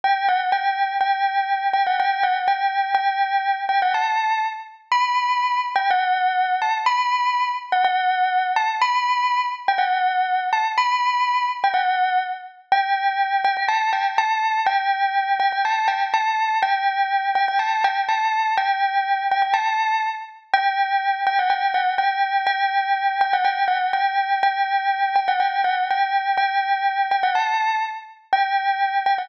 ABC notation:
X:1
M:2/4
L:1/16
Q:1/4=123
K:G
V:1 name="Tubular Bells"
g2 f z g4 | g6 g f | g2 f z g4 | g6 g f |
a4 z4 | [K:Em] b6 z g | f6 a z | b6 z f |
f6 a z | b6 z g | f6 a z | b6 z g |
f4 z4 | [K:G] g6 g g | a2 g z a4 | g6 g g |
a2 g z a4 | g6 g g | a2 g z a4 | g6 g g |
a4 z4 | g6 g f | g2 f z g4 | g6 g f |
g2 f z g4 | g6 g f | g2 f z g4 | g6 g f |
a4 z4 | g6 g f |]